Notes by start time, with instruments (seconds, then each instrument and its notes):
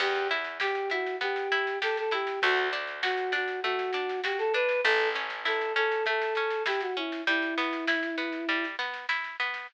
0.00 electric bass (finger) E2, acoustic guitar (steel) B3, choir aahs G4, kick, snare, crash
0.15 snare
0.31 acoustic guitar (steel) E4, snare
0.44 snare
0.60 choir aahs G4, acoustic guitar (steel) G4, snare
0.75 snare
0.90 acoustic guitar (steel) E4, choir aahs F#4, snare
1.06 snare
1.21 acoustic guitar (steel) B3, choir aahs G4, kick, snare
1.36 snare
1.52 acoustic guitar (steel) E4, snare
1.67 snare
1.82 acoustic guitar (steel) G4, choir aahs A4, snare
1.97 choir aahs A4, snare
2.11 acoustic guitar (steel) E4, choir aahs G4, snare
2.27 snare
2.42 electric bass (finger) D2, acoustic guitar (steel) A3, choir aahs F#4, kick, snare
2.57 snare
2.73 acoustic guitar (steel) D4, snare
2.87 snare
3.03 choir aahs F#4, acoustic guitar (steel) F#4, snare
3.17 snare
3.32 acoustic guitar (steel) D4, choir aahs F#4, snare
3.48 snare
3.63 acoustic guitar (steel) A3, choir aahs F#4, kick, snare
3.79 snare
3.93 acoustic guitar (steel) D4, snare
4.09 snare
4.24 acoustic guitar (steel) F#4, choir aahs G4, snare
4.39 choir aahs A4, snare
4.54 acoustic guitar (steel) D4, choir aahs B4, snare
4.69 snare
4.84 electric bass (finger) A1, acoustic guitar (steel) A3, choir aahs A4, kick, snare
4.99 snare
5.15 acoustic guitar (steel) C#4, snare
5.30 snare
5.45 acoustic guitar (steel) E4, choir aahs A4, snare
5.61 snare
5.76 acoustic guitar (steel) C#4, choir aahs A4, snare
5.92 snare
6.06 acoustic guitar (steel) A3, choir aahs A4, kick, snare
6.21 snare
6.35 acoustic guitar (steel) C#4, snare
6.51 snare
6.66 acoustic guitar (steel) E4, choir aahs G4, snare
6.81 choir aahs F#4, snare
6.97 acoustic guitar (steel) C#4, choir aahs E4
7.12 snare
7.27 acoustic guitar (steel) G3, choir aahs E4, kick, snare
7.42 snare
7.58 acoustic guitar (steel) B3, snare
7.73 snare
7.87 acoustic guitar (steel) E4, snare
8.03 snare
8.18 acoustic guitar (steel) B3, snare
8.32 snare
8.48 acoustic guitar (steel) G3, kick, snare
8.64 snare
8.79 acoustic guitar (steel) B3, snare
8.94 snare
9.09 acoustic guitar (steel) E4, snare
9.24 snare
9.40 acoustic guitar (steel) B3, snare
9.54 snare